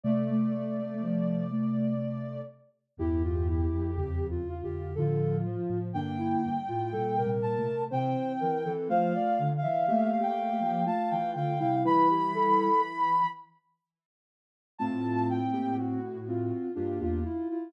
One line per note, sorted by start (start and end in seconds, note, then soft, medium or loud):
0.04 2.42 C3 medium
0.04 0.94 A3 medium
0.04 2.42 A3 medium
0.04 0.28 A3 medium
0.04 2.41 D5 medium
0.30 0.52 A3 medium
0.53 0.76 A3 medium
0.79 1.02 A3 medium
1.01 1.44 F3 medium
1.01 1.50 A3 medium
1.51 1.94 A3 medium
2.97 3.67 E2 loud
2.97 3.61 G2 medium
2.97 3.61 E3 medium
2.97 3.23 E4 loud
2.97 4.22 G4 medium
3.24 3.48 F4 medium
3.48 3.91 E4 medium
3.71 4.40 F2 medium
3.96 4.29 E2 medium
3.96 4.29 C#3 medium
3.96 4.27 G4 medium
4.30 4.61 E2 medium
4.30 4.61 C#3 medium
4.30 4.62 F4 medium
4.48 4.89 F4 medium
4.63 4.94 F2 medium
4.63 4.94 D3 medium
4.63 4.95 G4 medium
4.95 5.56 A2 medium
4.95 5.40 D3 medium
4.95 5.56 F3 medium
4.95 5.78 F4 medium
4.95 5.37 A4 medium
5.45 5.89 F3 medium
5.70 5.93 A2 medium
5.70 5.93 F3 medium
5.93 6.36 G2 medium
5.93 6.57 D3 medium
5.93 6.57 A#3 medium
5.93 6.18 D4 medium
5.93 7.28 G5 medium
6.18 6.42 E4 medium
6.44 6.68 G2 medium
6.68 6.92 A2 medium
6.68 6.92 F4 medium
6.92 7.24 A#2 medium
6.92 7.17 A#2 medium
6.92 7.24 G3 medium
6.92 7.16 A4 medium
7.17 7.40 C3 medium
7.17 7.84 A#4 medium
7.26 7.57 A#2 medium
7.26 7.57 G3 medium
7.42 7.67 A#2 medium
7.42 7.82 A5 medium
7.58 7.89 C3 medium
7.58 7.89 A3 medium
7.90 8.15 C3 medium
7.90 8.56 E3 medium
7.90 8.56 C4 medium
7.90 8.33 C5 medium
7.90 8.70 G5 medium
8.40 8.64 E3 medium
8.40 8.64 A#4 medium
8.65 8.88 E3 medium
8.65 8.88 C4 medium
8.65 8.88 A4 medium
8.89 9.12 F3 medium
8.89 9.50 A3 medium
8.89 9.50 F4 medium
8.89 9.13 C5 medium
8.89 9.48 F5 medium
9.15 9.38 D5 medium
9.39 9.62 D3 medium
9.57 10.17 F5 medium
9.62 9.86 E3 medium
9.62 9.86 E5 medium
9.88 10.60 A3 medium
9.88 10.19 A#3 medium
9.88 10.19 G4 medium
9.88 10.11 E5 medium
10.12 10.84 F5 medium
10.20 10.51 A#3 medium
10.20 10.51 G4 medium
10.20 10.83 G5 medium
10.53 10.84 A#3 medium
10.53 10.84 G4 medium
10.60 10.84 F3 medium
10.86 11.53 A3 medium
10.86 11.53 F4 medium
10.86 11.31 F5 medium
10.86 11.10 A5 medium
11.10 11.35 E3 medium
11.10 11.33 G5 medium
11.35 11.58 D3 medium
11.35 11.59 F5 medium
11.35 11.76 G5 medium
11.60 11.84 C3 medium
11.60 11.83 G3 medium
11.60 11.83 E4 medium
11.60 11.83 F5 medium
11.85 13.22 E3 loud
11.85 12.69 G3 medium
11.85 12.69 E4 medium
11.85 12.08 B4 medium
11.85 13.26 B5 loud
12.10 12.33 G4 medium
12.34 12.82 A4 medium
14.78 16.51 A2 medium
14.78 15.39 A3 medium
14.78 16.00 C4 loud
14.78 15.39 F4 medium
14.78 15.26 A5 medium
15.29 15.74 G5 medium
15.53 15.77 A#3 medium
15.53 15.77 G4 medium
15.78 16.18 F#4 medium
15.78 16.65 F#4 medium
16.27 16.69 C4 medium
16.27 16.72 F4 medium
16.75 17.00 G2 medium
16.75 17.00 A#3 medium
16.75 17.19 D4 medium
16.75 16.98 F4 medium
16.75 17.00 G4 medium
17.00 17.23 E2 medium
17.00 17.24 A#3 medium
17.00 17.24 F4 medium
17.00 17.24 G4 medium
17.25 17.48 E4 medium
17.25 17.49 F4 medium
17.50 17.73 E4 medium
17.50 17.73 F4 medium